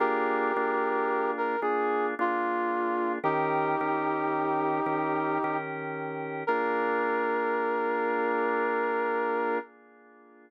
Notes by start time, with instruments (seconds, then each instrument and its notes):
0.00 drawbar organ A#3 D4 F4 G#4, brass section G4 A#4
0.56 drawbar organ A#3 D4 F4 G#4
1.37 brass section A#4
1.61 drawbar organ A#3 D4 F4 G#4, brass section G#4
2.19 drawbar organ A#3 D4 F4 G#4, brass section F4
3.23 drawbar organ D#3 C#4 G4 A#4, brass section D#4 G4
3.81 drawbar organ D#3 C#4 G4 A#4
4.86 drawbar organ D#3 C#4 G4 A#4
5.44 drawbar organ D#3 C#4 G4 A#4
6.47 drawbar organ A#3 D4 F4 G#4, brass section A#4